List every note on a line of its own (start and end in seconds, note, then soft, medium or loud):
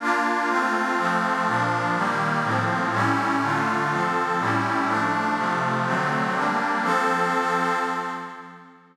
0.00 0.49 A#3 medium
0.00 0.49 D4 medium
0.00 0.49 F4 medium
0.49 0.97 A3 medium
0.49 0.97 C4 medium
0.49 0.97 F4 medium
0.98 1.46 F3 medium
0.98 1.46 A3 medium
0.98 1.46 C4 medium
1.46 1.95 A#2 medium
1.46 1.95 F3 loud
1.46 1.95 D4 medium
1.95 2.43 D#3 medium
1.95 2.43 G3 medium
1.95 2.43 A#3 medium
2.44 2.92 A2 medium
2.44 2.92 F3 medium
2.44 2.92 C4 medium
2.93 3.41 A2 medium
2.93 3.41 G3 medium
2.93 3.41 C#4 loud
2.93 3.41 E4 medium
3.42 3.90 D3 medium
3.42 3.90 A3 medium
3.42 3.90 F4 medium
3.91 4.39 F3 medium
3.91 4.39 C4 medium
3.91 4.39 A4 medium
4.39 4.88 A2 medium
4.39 4.88 G3 medium
4.39 4.88 C#4 medium
4.39 4.88 E4 medium
4.87 5.36 F3 medium
4.87 5.36 A3 medium
4.87 5.36 D4 medium
5.36 5.85 C3 medium
5.36 5.85 F3 medium
5.36 5.85 A3 medium
5.85 6.34 D3 medium
5.85 6.34 F#3 medium
5.85 6.34 A3 medium
5.85 6.34 C4 medium
6.34 6.82 G3 medium
6.34 6.82 A#3 medium
6.34 6.82 D4 medium
6.83 7.76 F3 medium
6.83 7.76 C4 loud
6.83 7.76 A4 loud